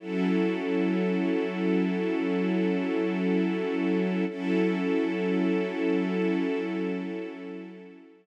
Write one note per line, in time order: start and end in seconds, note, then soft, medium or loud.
0.00 4.24 F#3 medium
0.00 4.24 C#4 medium
0.00 4.24 E4 medium
0.00 4.24 A4 medium
4.28 8.26 F#3 medium
4.28 8.26 C#4 medium
4.28 8.26 E4 medium
4.28 8.26 A4 medium